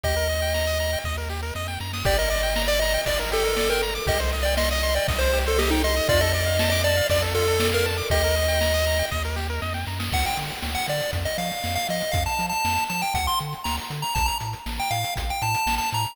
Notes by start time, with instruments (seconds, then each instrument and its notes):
0.03 synth bass 1 D#2, lead 1 (square) G4 D#5, kick, ride
0.16 lead 1 (square) A#4
0.29 lead 1 (square) D#5, ride
0.42 lead 1 (square) G5
0.54 lead 1 (square) A#5, snare
0.67 lead 1 (square) D#6
0.79 lead 1 (square) A#5, ride
0.93 lead 1 (square) G5
1.04 synth bass 1 D#2, lead 1 (square) D#5, kick, snare
1.17 lead 1 (square) A#4
1.29 lead 1 (square) G4, snare
1.42 lead 1 (square) A#4
1.55 synth bass 1 F2, lead 1 (square) D#5, snare
1.68 lead 1 (square) G5, snare
1.80 synth bass 1 F#2, lead 1 (square) A#5, snare
1.93 lead 1 (square) D#6, snare
2.05 synth bass 1 G1, lead 1 (square) G4 D5, kick, crash
2.18 lead 1 (square) A#4 D#5
2.30 lead 1 (square) D5 D#5, ride
2.43 lead 1 (square) G5
2.56 lead 1 (square) A#5, snare
2.68 lead 1 (square) D5 D6
2.80 lead 1 (square) D#5 A#5, ride
2.94 lead 1 (square) G5
3.06 synth bass 1 G1, lead 1 (square) D5, kick, ride
3.19 lead 1 (square) A#4
3.31 lead 1 (square) G4 A4, ride
3.44 lead 1 (square) A#4
3.56 lead 1 (square) D5, snare
3.70 lead 1 (square) A#4 G5
3.82 lead 1 (square) A#5, ride
3.95 lead 1 (square) D6
4.07 synth bass 1 C2, lead 1 (square) G4 D#5, kick, ride
4.20 lead 1 (square) C5
4.32 lead 1 (square) D#5, ride
4.43 lead 1 (square) D5 G5
4.57 lead 1 (square) D#5 C6, snare
4.71 lead 1 (square) D#5 D#6
4.83 lead 1 (square) C6, ride
4.95 lead 1 (square) D5 G5
5.08 synth bass 1 C2, lead 1 (square) D#5, kick, ride
5.18 lead 1 (square) C5
5.33 lead 1 (square) G4, ride
5.46 lead 1 (square) A4 C5
5.58 lead 1 (square) G4 D#5, snare
5.70 lead 1 (square) D#4 G5
5.84 lead 1 (square) D#5 C6, ride
5.96 lead 1 (square) D#6
6.09 synth bass 1 F2, lead 1 (square) F4 D5, kick, ride
6.21 lead 1 (square) A4 D#5
6.33 lead 1 (square) D5 D#5, ride
6.46 lead 1 (square) F5
6.59 lead 1 (square) A5, snare
6.70 lead 1 (square) D#5 D6
6.84 lead 1 (square) D5 A5, ride
6.97 lead 1 (square) F5
7.09 synth bass 1 F2, lead 1 (square) D5, kick, ride
7.22 lead 1 (square) A4
7.35 lead 1 (square) F4 A4, ride
7.48 lead 1 (square) A4
7.60 lead 1 (square) D5, snare
7.72 lead 1 (square) A#4 F5
7.85 lead 1 (square) A5, ride
7.97 lead 1 (square) D6
8.10 synth bass 1 D#2, lead 1 (square) G4 D#5, kick, ride
8.24 lead 1 (square) A#4
8.35 lead 1 (square) D#5, ride
8.48 lead 1 (square) G5
8.61 lead 1 (square) A#5, snare
8.74 lead 1 (square) D#6
8.86 lead 1 (square) A#5, ride
8.99 lead 1 (square) G5
9.11 synth bass 1 D#2, lead 1 (square) D#5, kick, snare
9.24 lead 1 (square) A#4
9.36 lead 1 (square) G4, snare
9.50 lead 1 (square) A#4
9.62 synth bass 1 F2, lead 1 (square) D#5, snare
9.74 lead 1 (square) G5, snare
9.86 synth bass 1 F#2, lead 1 (square) A#5, snare
9.99 lead 1 (square) D#6, snare
10.12 synth bass 1 D2, lead 1 (square) F#5, kick, crash
10.25 lead 1 (square) G5, closed hi-hat
10.37 synth bass 1 D3, closed hi-hat
10.50 closed hi-hat
10.62 synth bass 1 D2, snare
10.75 lead 1 (square) F#5, closed hi-hat
10.88 synth bass 1 D3, lead 1 (square) D5, closed hi-hat
11.00 closed hi-hat
11.13 synth bass 1 F2, kick, closed hi-hat
11.25 lead 1 (square) D#5, closed hi-hat
11.38 synth bass 1 F3, lead 1 (square) F5, closed hi-hat
11.51 closed hi-hat
11.64 synth bass 1 F2, snare
11.75 lead 1 (square) F5, closed hi-hat
11.89 synth bass 1 F3, lead 1 (square) D#5, closed hi-hat
12.01 closed hi-hat
12.12 synth bass 1 F2, lead 1 (square) F5, kick, closed hi-hat
12.26 lead 1 (square) A5, closed hi-hat
12.39 synth bass 1 F3, closed hi-hat
12.49 lead 1 (square) A5, closed hi-hat
12.65 synth bass 1 F2, snare
12.77 closed hi-hat
12.89 synth bass 1 F3, lead 1 (square) A5, closed hi-hat
13.02 lead 1 (square) G5, closed hi-hat
13.14 synth bass 1 D2, lead 1 (square) F#5, kick, closed hi-hat
13.27 lead 1 (square) C6, closed hi-hat
13.39 synth bass 1 D3, closed hi-hat
13.53 closed hi-hat
13.64 synth bass 1 D2, lead 1 (square) A#5, snare
13.77 closed hi-hat
13.90 synth bass 1 D3, closed hi-hat
14.02 lead 1 (square) A#5, closed hi-hat
14.15 synth bass 1 A1, lead 1 (square) A5, kick, closed hi-hat
14.26 lead 1 (square) A#5, closed hi-hat
14.40 synth bass 1 A2, closed hi-hat
14.53 closed hi-hat
14.66 synth bass 1 A1, snare
14.79 lead 1 (square) G5, closed hi-hat
14.91 synth bass 1 A2, lead 1 (square) F5, closed hi-hat
15.04 closed hi-hat
15.16 synth bass 1 A1, kick, closed hi-hat
15.29 lead 1 (square) G5, closed hi-hat
15.42 synth bass 1 A2, lead 1 (square) A5, closed hi-hat
15.54 closed hi-hat
15.66 synth bass 1 A1, snare
15.78 lead 1 (square) A5, closed hi-hat
15.92 synth bass 1 A2, lead 1 (square) A#5, closed hi-hat
16.05 closed hi-hat